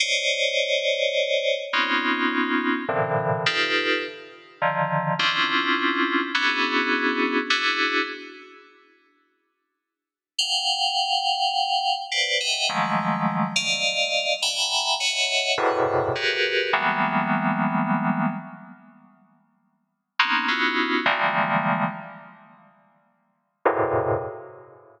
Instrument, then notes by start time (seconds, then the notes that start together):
electric piano 2
0.00 C5 C#5 D5 D#5
1.73 B3 C4 C#4 D#4 F4
2.88 A2 A#2 C3 D3 E3
3.46 D#4 F4 G4 A4 B4
4.62 D3 D#3 F3
5.19 C4 C#4 D4 E4 F4
6.35 B3 C#4 D4 E4 F#4 G#4
7.50 D4 E4 F#4 G#4
10.38 F5 F#5 G5
12.12 B4 C5 D5
12.40 D#5 E5 F#5 G5
12.69 D#3 F3 F#3 G#3 A3
13.56 D5 D#5 F5
14.42 E5 F#5 G5 G#5 A#5 B5
15.00 C#5 D#5 E5 F#5
15.58 E2 F#2 G#2 A2 B2 C3
16.15 F#4 G4 G#4 A#4 B4
16.73 E3 F#3 G3 G#3 A#3 B3
20.19 A#3 B3 C4 C#4 D#4
20.48 B3 C#4 D#4 E4 F4 F#4
21.06 D3 E3 F3 G3 G#3 A#3
23.65 E2 F#2 G#2 A2 A#2 C3